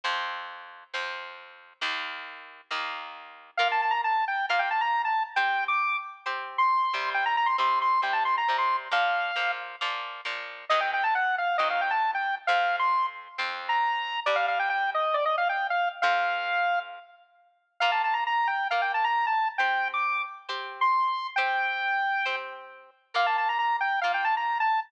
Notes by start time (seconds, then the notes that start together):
0.04 F2 F3 C4
0.94 F2 F3 C4
1.81 D#2 D#3 A#3
2.70 D#2 D#3 A#3
3.57 A#3 F4 A#4 F5
3.72 A5
3.82 A5
3.91 A#5
4.04 A5
4.28 G5
4.49 A#3 F4 A#4 F5
4.59 G5
4.71 A5
4.81 A#5
5.05 A5
5.36 C4 G4 C5 G5
5.68 D6
6.26 C4 G4 C5
6.58 C6
6.93 C3 G3 C4
7.14 G5
7.26 A#5
7.37 A#5
7.46 C6
7.58 C3 G3 C4 C6
7.82 C6
8.02 C3 G3 C4 G5
8.13 A5
8.25 C6
8.38 A#5
8.48 C3 G3 C4
8.58 C6
8.91 A#2 F3 A#3 F5
9.36 A#2 F3 A#3
9.81 A#2 F3 A#3
10.25 A#2 F3 A#3
10.69 D#3 F#3 C4 D#5
10.80 G5
10.94 G5
11.04 A5
11.15 F#5
11.38 F5
11.58 D#3 F#3 C4 D#5
11.70 F5
11.81 G5
11.91 A5
12.15 G5
12.47 F2 F3 C4 F5
12.79 C6
13.38 F2 F3 C4
13.69 A#5
14.26 G2 G3 D4 D5
14.36 F5
14.48 F5
14.59 G5
14.70 G5
14.94 D#5
15.14 D5
15.25 D#5
15.38 F5
15.49 G5
15.70 F5
16.02 F2 F3 C4 F5
17.80 A#3 F4 A#4 F5
17.92 A5
18.04 A5
18.14 A#5
18.27 A#5
18.47 G5
18.71 A#3 F4 A#4 F5
18.82 G5
18.94 A5
19.04 A#5
19.27 A5
19.58 C4 G4 C5 G5
19.94 D6
20.49 C4 G4 C5
20.81 C6
21.36 C4 G4 C5 G5
22.25 C4 G4 C5
23.14 A#3 F4 A#4 F5
23.26 A5
23.38 A5
23.49 A#5
23.59 A#5
23.81 G5
24.01 A#3 F4 A#4 F5
24.14 G5
24.25 A5
24.37 A#5
24.60 A5